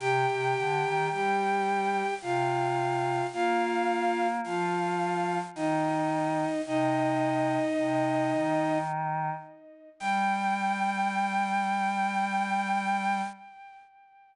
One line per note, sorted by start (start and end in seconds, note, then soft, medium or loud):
0.00 0.26 C3 loud
0.00 1.09 G4 loud
0.00 1.09 G5 loud
0.28 0.54 C3 medium
0.56 0.83 D3 medium
0.83 1.09 D#3 medium
1.11 2.02 G3 medium
1.11 2.14 G4 medium
1.11 2.14 G5 loud
2.22 3.21 C3 medium
2.22 3.26 F4 medium
2.22 3.26 F5 loud
3.33 4.40 A#3 loud
3.33 4.27 F4 loud
3.33 4.27 F5 loud
4.44 5.40 F3 medium
4.44 5.38 F4 medium
4.44 5.38 F5 medium
5.55 6.45 D#3 medium
5.55 6.61 D#4 medium
5.55 6.61 D#5 loud
6.67 7.58 C3 medium
6.67 8.78 D#4 loud
6.67 8.78 D#5 loud
7.78 8.32 C3 medium
8.33 9.30 D#3 medium
10.00 13.22 G3 loud
10.00 13.21 G5 loud